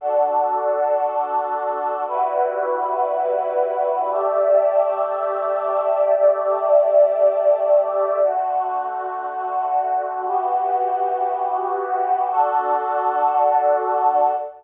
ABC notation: X:1
M:4/4
L:1/8
Q:1/4=117
K:D
V:1 name="Pad 2 (warm)"
[DFA]8 | [G,EFB]8 | [A,Gde]8 | [A,Gde]8 |
[D,A,F]8 | [E,B,FG]8 | [DFA]8 |]